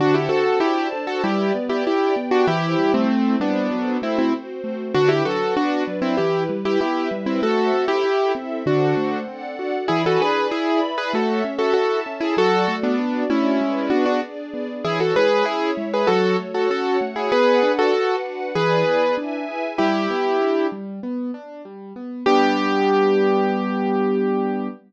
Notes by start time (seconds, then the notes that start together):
0.00 D3 D4 F#4 C5 F#5 A5
0.14 E4 G4
0.29 C4 F#4 A4
0.60 D4 E4 F#4 G4 C5 D5 A5
0.93 A4
1.07 F#4 A4
1.24 G3 E4 G4 B4 D5
1.55 B3
1.69 E4 G4
1.85 D4 E4 G4 D5 G5
2.16 B3
2.31 D4 F#4
2.47 E3 E4 G4 C5
2.78 G3
2.94 A3 C4
3.09 C4 E4 C5
3.40 G3 B3 D4
3.71 F#3 F#4 A4 C5
4.02 A3 C4 E4
4.19 C4 E4
4.33 C4 F#4 C5
4.64 A3
4.94 D3 D4 F#4 B4
5.09 E4 G4
5.25 F#3 F#4 A4
5.57 B3 D4 F#4 B4 D5
5.88 F#3
6.02 C4 E4
6.17 E3 E4 G4 B4
6.49 G3
6.65 E4 G4
6.80 B3 E4 G4 B4 E5
7.11 G3
7.26 C4 E4
7.42 A3 F#4 A4 C5 E5
7.73 C4
7.88 E4 G4
8.04 E4 A4 E5
8.35 C4
8.66 D3 D4 F#4 A4 C5 F#5
8.97 A3
9.28 C4 D4 A4 D5 F#5
9.59 F#4
9.88 E3 E4 G#4 D5 G#5 B5
10.06 F#4 A4
10.21 D4 G#4 B4
10.51 E4 G#4 D5 E5 B5
10.83 B4
10.98 G#4 B4
11.13 A3 F#4 A4 C#5 E5
11.44 C#4
11.59 F#4 A4
11.73 E4 F#4 A4 E5 A5
12.06 C#4
12.20 E4 G#4
12.37 F#3 F#4 A4 D5
12.68 A3
12.83 B3 D4
12.99 D4 F#4 D5
13.30 A3 C#4 E4
13.61 G#3 G#4 B4 D5
13.90 B3 D4 F#4
14.06 D4 F#4
14.23 D4 G#4 D5
14.54 B3
14.85 E3 E4 G#4 C#5
15.00 F#4 A4
15.15 G#3 G#4 B4
15.45 C#4 E4 G#4 C#5 E5
15.77 G#3
15.94 G#4 B4
16.07 F#3 F#4 A4 C#5
16.39 A3
16.54 F#4 A4
16.70 C#4 F#4 A4 C#5 F#5
17.01 A3
17.16 E4 G#4
17.32 B3 G#4 B4 D5 F#5
17.63 D4
17.79 F#4 A4
17.94 F#4 B4 F#5
18.25 D4
18.55 E3 E4 G#4 B4 D5 G#5
18.87 B3
19.17 D4 E4 B4 E5 G#5
19.48 G#4
19.78 G3 E4 G4
20.10 B3
20.41 D4
20.72 G3
21.03 B3
21.34 D4
21.65 G3
21.96 B3
22.26 G3 B3 D4 G4